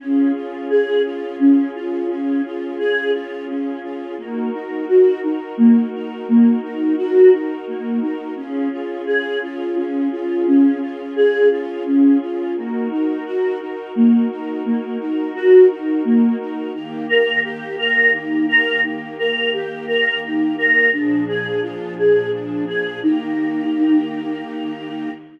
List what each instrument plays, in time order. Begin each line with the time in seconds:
0.00 choir aahs C#4, pad 5 (bowed) C#4 F4 G#4
0.35 choir aahs F4
0.70 choir aahs G#4
1.05 choir aahs F4
1.39 choir aahs C#4
1.75 choir aahs F4
2.10 choir aahs C#4
2.45 choir aahs F4
2.79 choir aahs G#4
3.14 choir aahs F4
3.48 choir aahs C#4
3.83 choir aahs F4
4.18 choir aahs A#3, pad 5 (bowed) D#4 F#4 A#4
4.54 choir aahs D#4
4.88 choir aahs F#4
5.23 choir aahs D#4
5.57 choir aahs A#3
5.94 choir aahs D#4
6.28 choir aahs A#3
6.63 choir aahs D#4
6.98 choir aahs F#4
7.33 choir aahs D#4
7.68 choir aahs A#3
8.02 choir aahs D#4
8.36 choir aahs C#4, pad 5 (bowed) C#4 F4 G#4
8.72 choir aahs F4
9.07 choir aahs G#4
9.43 choir aahs F4
9.76 choir aahs C#4
10.12 choir aahs F4
10.47 choir aahs C#4
10.81 choir aahs F4
11.16 choir aahs G#4
11.51 choir aahs F4
11.86 choir aahs C#4
12.21 choir aahs F4
12.56 choir aahs A#3, pad 5 (bowed) D#4 F#4 A#4
12.91 choir aahs D#4
13.26 choir aahs F#4
13.60 choir aahs D#4
13.95 choir aahs A#3
14.31 choir aahs D#4
14.65 choir aahs A#3
15.00 choir aahs D#4
15.35 choir aahs F#4
15.70 choir aahs D#4
16.05 choir aahs A#3
16.40 choir aahs D#4
16.74 pad 5 (bowed) D#3 A#3 G4, choir aahs D#4
17.09 choir aahs A#4
17.44 choir aahs G4
17.78 choir aahs A#4
18.14 choir aahs D#4
18.49 choir aahs A#4
18.84 choir aahs D#4
19.18 choir aahs A#4
19.53 choir aahs G4
19.87 choir aahs A#4
20.24 choir aahs D#4
20.58 choir aahs A#4
20.92 pad 5 (bowed) A#2 F3 D4 G#4, choir aahs D4
21.28 choir aahs G#4
21.62 choir aahs F4
21.98 choir aahs G#4
22.33 choir aahs D4
22.67 choir aahs G#4
23.01 pad 5 (bowed) D#3 A#3 G4, choir aahs D#4